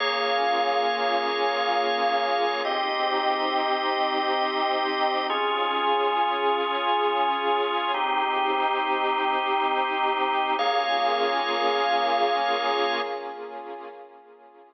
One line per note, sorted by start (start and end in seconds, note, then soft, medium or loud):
0.00 2.62 A#3 medium
0.00 2.62 C#4 medium
0.00 2.62 F4 medium
0.00 2.62 G#4 medium
0.00 2.62 C#5 medium
0.00 2.62 F5 medium
2.65 5.27 C4 medium
2.65 5.27 D#4 medium
2.65 5.27 G4 medium
2.65 5.27 D#5 medium
5.29 7.91 C#4 medium
5.29 7.92 C#4 medium
5.29 7.91 F4 medium
5.29 7.92 F4 medium
5.29 7.91 G#4 medium
5.29 7.92 G#4 medium
7.94 10.56 C4 medium
7.94 10.56 D#4 medium
7.94 10.56 G4 medium
10.59 13.01 A#3 loud
10.59 13.01 C#4 loud
10.59 13.01 F4 medium
10.59 13.01 G#4 loud
10.59 13.01 C#5 medium
10.59 13.01 F5 medium